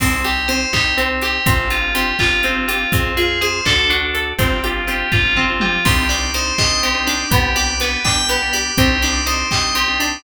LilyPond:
<<
  \new Staff \with { instrumentName = "Tubular Bells" } { \time 6/8 \key c \minor \tempo 4. = 82 c'8 g'8 c''8 g'8 c'8 g'8 | c'8 f'8 g'8 f'8 c'8 f'8 | c'8 aes'8 c''8 a'8 d'8 a'8 | c'8 f'8 g'8 f'8 c'8 f'8 |
g'8 d''8 c''8 ees''8 g'8 d''8 | g'8 d''8 b'8 g''8 g'8 d''8 | g'8 d''8 c''8 ees''8 g'8 d''8 | }
  \new Staff \with { instrumentName = "Drawbar Organ" } { \time 6/8 \key c \minor <c' ees' g'>8 <c' ees' g'>8 <c' ees' g'>8 <c' ees' g'>8. <c' ees' g'>8. | <c' d' f' g'>8 <c' d' f' g'>8 <c' d' f' g'>8 <c' d' f' g'>8. <c' d' f' g'>8. | <c' f' aes'>8 <c' f' aes'>8 <c' f' aes'>8 <d' fis' a'>8. <d' fis' a'>8. | <c' d' f' g'>8 <c' d' f' g'>8 <c' d' f' g'>8 <c' d' f' g'>8. <c' d' f' g'>8. |
<c' d' ees' g'>8 <c' d' ees' g'>8 <c' d' ees' g'>8 <c' d' ees' g'>8. <c' d' ees' g'>8. | <b d' g'>8 <b d' g'>8 <b d' g'>8 <b d' g'>8. <b d' g'>8. | <c' d' ees' g'>8 <c' d' ees' g'>8 <c' d' ees' g'>8 <c' d' ees' g'>8. <c' d' ees' g'>8. | }
  \new Staff \with { instrumentName = "Pizzicato Strings" } { \time 6/8 \key c \minor c'8 g'8 c'8 ees'8 c'8 g'8 | c'8 g'8 c'8 f'8 c'8 g'8 | c'8 f'8 aes'8 d'8 fis'8 a'8 | c'8 g'8 c'8 f'8 c'8 g'8 |
c'8 d'8 ees'8 g'8 c'8 d'8 | b8 g'8 b8 d'8 b8 g'8 | c'8 d'8 ees'8 g'8 c'8 d'8 | }
  \new Staff \with { instrumentName = "Electric Bass (finger)" } { \clef bass \time 6/8 \key c \minor c,4. c,4. | g,,4. g,,4. | f,4. d,4. | g,,4. g,,4. |
c,4. c,4. | c,4. c,4. | c,4. c,4. | }
  \new DrumStaff \with { instrumentName = "Drums" } \drummode { \time 6/8 <cymc bd>8 hh8 hh8 <hc bd>8 hh8 hh8 | <hh bd>8 hh8 hh8 <hc bd>8 hh8 hh8 | <hh bd>8 hh8 hh8 <hc bd>8 hh8 hh8 | <hh bd>8 hh8 hh8 <bd tomfh>8 toml8 tommh8 |
<cymc bd>8 hh8 hh8 <hc bd>8 hh8 hh8 | <hh bd>8 hh8 hh8 <hc bd>8 hh8 hh8 | <hh bd>8 hh8 hh8 <hc bd>8 hh8 hh8 | }
>>